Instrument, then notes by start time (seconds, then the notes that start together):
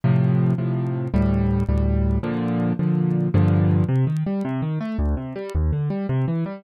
acoustic grand piano
0.04 A2 C3 F3
0.58 A2 C3 F3
1.14 D2 A2 G3
1.69 D2 A2 G3
2.23 A#2 D3 F3
2.79 A#2 D3 F3
3.34 G2 A#2 D3 F3
3.88 C3
4.07 D#3
4.26 G3
4.45 C3
4.62 D#3
4.80 A3
4.98 D2
5.17 C3
5.35 G3
5.55 D#2
5.72 D3
5.90 G3
6.09 C3
6.28 E3
6.46 G3